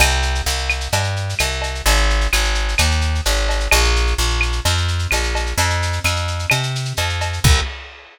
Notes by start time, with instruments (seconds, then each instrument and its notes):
0.00 electric bass (finger) C2, cowbell, claves, shaker
0.10 shaker
0.22 shaker
0.35 shaker
0.46 electric bass (finger) C2, shaker
0.58 shaker
0.69 claves, shaker
0.81 shaker
0.92 electric bass (finger) G2, cowbell, shaker
1.04 shaker
1.16 shaker
1.29 shaker
1.39 electric bass (finger) C2, cowbell, claves, shaker
1.52 shaker
1.62 cowbell, shaker
1.75 shaker
1.86 electric bass (finger) G#1, cowbell, shaker
1.97 shaker
2.10 shaker
2.21 shaker
2.33 electric bass (finger) G#1, claves, shaker
2.44 shaker
2.55 shaker
2.68 shaker
2.78 electric bass (finger) D#2, cowbell, claves, shaker
2.91 shaker
3.01 shaker
3.15 shaker
3.25 electric bass (finger) G#1, cowbell, shaker
3.37 shaker
3.49 cowbell, shaker
3.60 shaker
3.71 electric bass (finger) A#1, cowbell, claves, shaker
3.84 shaker
3.96 shaker
4.07 shaker
4.18 electric bass (finger) A#1, shaker
4.30 shaker
4.41 claves, shaker
4.52 shaker
4.65 electric bass (finger) F2, cowbell, shaker
4.78 shaker
4.88 shaker
4.99 shaker
5.11 electric bass (finger) A#1, cowbell, claves, shaker
5.23 shaker
5.35 cowbell, shaker
5.46 shaker
5.58 electric bass (finger) F2, cowbell, shaker
5.70 shaker
5.82 shaker
5.93 shaker
6.04 electric bass (finger) F2, claves, shaker
6.16 shaker
6.28 shaker
6.39 shaker
6.50 electric bass (finger) C3, cowbell, claves, shaker
6.63 shaker
6.75 shaker
6.85 shaker
6.97 electric bass (finger) F2, cowbell, shaker
7.09 shaker
7.21 cowbell, shaker
7.33 shaker
7.44 electric bass (finger) C2, kick, crash